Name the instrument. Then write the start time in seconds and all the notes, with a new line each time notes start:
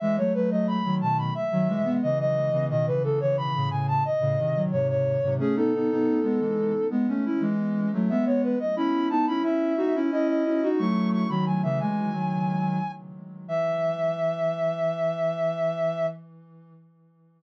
ocarina
0.00 E3 G#3 E5
0.17 F#3 A3 C#5
0.34 F#3 A3 B4
0.51 F#3 A3 D#5
0.67 B5
0.84 D#3 F#3
1.01 B2 D#3 A5
1.18 B5
1.35 E5
1.51 D#3 F#3
1.68 E3 G#3
1.84 G#3 B3
2.02 C#3 E3 D#5
2.19 D#5
2.52 C#3 E3
2.69 B2 D#3 D#5
2.86 C#3 E3 B4
3.03 C#3 E3 A4
3.20 C#3 E3 C#5
3.37 B5
3.55 A2 C#3
3.70 A2 C#3 G#5
3.88 A5
4.05 D#5
4.20 A2 C#3
4.38 C3 D#3
4.55 D#3 F#3
4.72 G#2 C3 C#5
4.89 C#5
5.23 G#2 C3
5.39 A3 C#4 G#4
5.55 B3 D#4 A4
5.74 B3 D#4
5.91 B3 D#4
6.23 G#3 B3
6.40 E3 G#3
6.90 G#3 B3
7.08 A3 C#4
7.26 C#4 E4
7.41 E3 G#3
7.93 F#3 A3
8.09 G#3 B3 E5
8.26 G#3 B3 C#5
8.43 B4
8.59 D#5
8.76 C#4 E4 B5
9.10 B3 D#4 A5
9.27 C#4 E4 B5
9.42 C#4 E4 E5
9.77 D#4 F#4
9.95 C#4 E4
10.11 C#4 E4 D#5
10.28 D#5
10.46 C#4 E4
10.63 D#4 F#4
10.79 F#3 A3 C#6
11.12 C#6
11.29 D#3 F#3 B5
11.46 D#3 F#3 G#5
11.63 C#3 E3 E5
11.80 E3 G#3 G#5
12.12 D#3 F#3
13.48 E3 E5